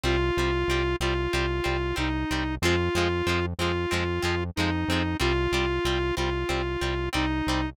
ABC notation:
X:1
M:4/4
L:1/8
Q:1/4=93
K:Fm
V:1 name="Lead 1 (square)"
F3 F3 E2 | F3 F3 E2 | F3 F3 E2 |]
V:2 name="Acoustic Guitar (steel)"
[G,C] [G,C] [G,C] [G,C] [G,C] [G,C] [G,C] [G,C] | [F,A,C] [F,A,C] [F,A,C] [F,A,C] [F,A,C] [F,A,C] [F,A,C] [F,A,C] | [G,C] [G,C] [G,C] [G,C] [G,C] [G,C] [G,C] [G,C] |]
V:3 name="Synth Bass 1" clef=bass
C,, C,, C,, C,, C,, C,, C,, C,, | F,, F,, F,, F,, F,, F,, F,, F,, | C,, C,, C,, C,, C,, C,, C,, C,, |]